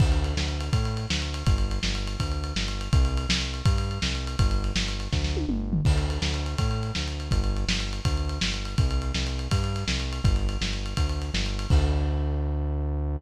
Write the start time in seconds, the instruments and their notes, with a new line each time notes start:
0.00 synth bass 1 D2, kick, crash
0.12 ride
0.24 ride
0.37 synth bass 1 D2, snare
0.49 ride
0.60 ride
0.73 synth bass 1 A2, kick, ride
0.85 ride
0.97 ride
1.10 synth bass 1 D2, snare
1.22 ride
1.34 ride
1.46 synth bass 1 G1, kick, ride
1.58 ride
1.71 ride
1.83 synth bass 1 G1, snare
1.95 ride
2.07 ride
2.20 synth bass 1 D2, kick, ride
2.32 ride
2.44 ride
2.56 synth bass 1 G1, snare
2.68 ride
2.81 ride
2.93 synth bass 1 C2, kick, ride
3.05 ride
3.17 ride
3.29 synth bass 1 C2, snare
3.41 ride
3.54 ride
3.65 synth bass 1 G2, kick, ride
3.78 ride
3.91 ride
4.02 synth bass 1 C2, snare
4.15 ride
4.27 ride
4.39 synth bass 1 G1, kick, ride
4.51 ride
4.64 ride
4.75 synth bass 1 G1, snare
4.88 ride
5.00 ride
5.12 synth bass 1 D2, kick, snare
5.24 snare
5.37 high tom
5.48 synth bass 1 G1, mid tom
5.73 floor tom
5.85 synth bass 1 D2, kick, crash
5.98 ride
6.10 ride
6.22 synth bass 1 D2, snare
6.34 ride
6.46 ride
6.58 synth bass 1 A2, kick, ride
6.71 ride
6.83 ride
6.95 synth bass 1 D2, snare
7.08 ride
7.20 ride
7.31 synth bass 1 G1, kick, ride
7.44 ride
7.57 ride
7.67 synth bass 1 G1, snare
7.80 ride
7.93 ride
8.05 synth bass 1 D2, kick, ride
8.17 ride
8.29 ride
8.41 synth bass 1 G1, snare
8.54 ride
8.65 ride
8.78 synth bass 1 C2, kick, ride
8.91 ride
9.02 ride
9.14 synth bass 1 C2, snare
9.27 ride
9.39 ride
9.51 synth bass 1 G2, kick, ride
9.64 ride
9.76 ride
9.88 synth bass 1 C2, snare
10.00 ride
10.13 ride
10.24 synth bass 1 G1, kick, ride
10.36 ride
10.49 ride
10.61 synth bass 1 G1, snare
10.73 ride
10.86 ride
10.97 synth bass 1 D2, kick, ride
11.09 ride
11.22 ride
11.34 synth bass 1 G1, snare
11.46 ride
11.59 ride
11.70 synth bass 1 D2, kick, crash